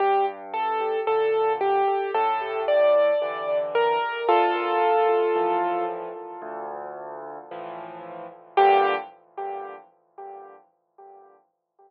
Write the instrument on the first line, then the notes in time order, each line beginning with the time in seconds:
acoustic grand piano
0.00 G2 G4
0.54 A4
1.07 A#2 D3 A4
1.61 G4
2.14 A2 A4
2.68 D5
3.22 D3 E3
3.75 A#4
4.28 D2 F4 A4
5.35 A2 E3 F3
6.42 D2
7.51 A2 E3 F3
8.57 G2 A#2 D3 G4